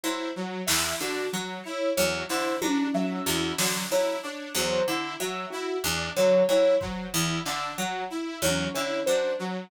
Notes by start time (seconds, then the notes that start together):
0.03 F#3 E4 C5
0.36 F#3
0.67 E2 E4 E5, snare
1.00 D3 D4 F#4, clap
1.33 F#3
1.64 E4 C#5
1.97 E2 F#3 C#5
2.29 D3 E4 C5, snare
2.62 F#3 D4, high tom
2.94 F#3 E5
3.26 E2 E4 F#4, clap
3.58 D3 F#3, snare
3.91 F#3 E4 C#5
4.23 D4 C#5
4.55 E2 F#3 C5
4.87 D3 E4
5.20 F#3 E5
5.50 E4 F#4
5.84 E2 D4
6.17 D3 F#3 C#5
6.49 F#3 E4 C#5, cowbell
6.81 F#3 C5, kick
7.13 E2 E4
7.46 D3 D4 E5, clap
7.78 F#3 F#4
8.10 E4
8.42 E2 F#3 C#5, high tom
8.74 D3 E4 C#5, cowbell
9.06 F#3 D4 C5
9.39 F#3